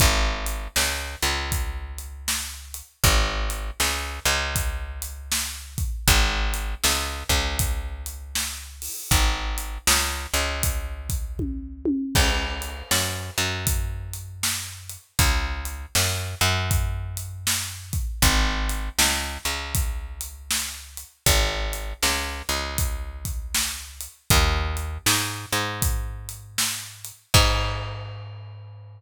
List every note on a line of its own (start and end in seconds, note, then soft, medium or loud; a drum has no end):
0.00 0.68 G#1 medium
0.00 kick loud
0.00 closed hi-hat medium
0.47 closed hi-hat medium
0.76 1.16 C#2 medium
0.76 snare loud
1.22 2.82 C#2 medium
1.22 closed hi-hat medium
1.52 kick medium
1.52 closed hi-hat medium
1.98 closed hi-hat medium
2.28 snare medium
2.74 closed hi-hat medium
3.04 3.71 G#1 medium
3.04 kick medium
3.04 closed hi-hat medium
3.50 closed hi-hat medium
3.80 4.19 C#2 medium
3.80 snare medium
4.25 5.85 C#2 medium
4.25 closed hi-hat medium
4.56 kick medium
4.56 closed hi-hat medium
5.02 closed hi-hat medium
5.32 snare loud
5.78 kick medium
5.78 closed hi-hat medium
6.08 6.75 G#1 medium
6.08 kick medium
6.08 closed hi-hat loud
6.54 closed hi-hat medium
6.84 7.24 C#2 medium
6.84 snare loud
7.29 8.89 C#2 medium
7.29 kick medium
7.29 closed hi-hat medium
7.59 kick medium
7.59 closed hi-hat loud
8.06 closed hi-hat medium
8.35 snare medium
8.82 open hi-hat medium
9.11 9.78 G#1 medium
9.11 kick medium
9.11 closed hi-hat loud
9.58 closed hi-hat medium
9.87 10.27 C#2 medium
9.87 snare loud
10.34 11.93 C#2 medium
10.34 closed hi-hat medium
10.63 kick medium
10.63 closed hi-hat loud
11.09 kick medium
11.09 closed hi-hat medium
11.39 kick medium
11.39 high tom medium
11.85 high tom loud
12.15 12.83 C#2 medium
12.15 kick medium
12.15 crash loud
12.62 closed hi-hat medium
12.91 13.31 F#2 medium
12.91 snare loud
13.38 14.97 F#2 medium
13.38 closed hi-hat medium
13.67 kick medium
13.67 closed hi-hat loud
14.13 closed hi-hat medium
14.43 snare loud
14.90 closed hi-hat medium
15.19 15.86 C#2 medium
15.19 kick medium
15.19 closed hi-hat loud
15.65 closed hi-hat medium
15.95 16.35 F#2 medium
15.95 snare loud
16.41 18.00 F#2 medium
16.41 closed hi-hat medium
16.71 kick medium
16.71 closed hi-hat medium
17.17 closed hi-hat medium
17.47 snare loud
17.93 kick medium
17.93 closed hi-hat medium
18.22 18.89 G#1 medium
18.22 kick medium
18.22 closed hi-hat loud
18.69 closed hi-hat medium
18.99 19.38 C#2 medium
18.99 snare loud
19.45 21.04 C#2 medium
19.45 closed hi-hat medium
19.75 kick medium
19.75 closed hi-hat medium
20.21 closed hi-hat medium
20.51 snare loud
20.97 closed hi-hat medium
21.26 21.93 G#1 medium
21.26 kick medium
21.26 closed hi-hat loud
21.73 closed hi-hat medium
22.03 22.42 C#2 medium
22.03 snare medium
22.49 24.08 C#2 medium
22.49 closed hi-hat medium
22.78 kick medium
22.78 closed hi-hat medium
23.25 kick medium
23.25 closed hi-hat medium
23.54 snare loud
24.01 closed hi-hat medium
24.30 24.98 D#2 medium
24.30 kick loud
24.30 closed hi-hat loud
24.77 closed hi-hat medium
25.06 25.46 G#2 medium
25.06 snare loud
25.52 27.12 G#2 medium
25.52 closed hi-hat medium
25.82 kick medium
25.82 closed hi-hat loud
26.29 closed hi-hat medium
26.58 snare loud
27.05 closed hi-hat medium
27.34 29.01 G#2 loud
27.34 kick loud
27.34 crash loud